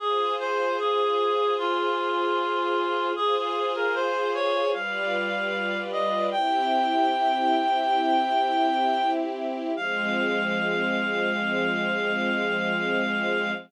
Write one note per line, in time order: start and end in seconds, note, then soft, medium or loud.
0.00 3.13 F4 medium
0.00 0.33 G#4 loud
0.00 3.13 G#4 loud
0.00 3.13 C5 medium
0.39 0.77 C5 loud
0.79 1.54 G#4 loud
1.58 3.10 F4 loud
3.16 4.72 F4 loud
3.16 4.72 G#4 loud
3.16 3.35 G#4 loud
3.16 4.72 C5 loud
3.36 3.72 G#4 medium
3.75 3.94 A#4 medium
3.95 4.30 C5 medium
4.34 4.69 C#5 loud
4.74 6.30 G3 loud
4.74 6.30 F4 loud
4.74 6.30 B4 loud
4.74 6.30 D5 loud
4.74 5.78 F5 medium
5.92 6.26 D#5 medium
6.32 9.73 C4 medium
6.32 9.73 E4 loud
6.32 9.73 G4 loud
6.32 9.10 G5 loud
9.76 13.51 F3 loud
9.76 13.51 G#3 loud
9.76 13.51 C4 loud
9.76 13.51 F5 loud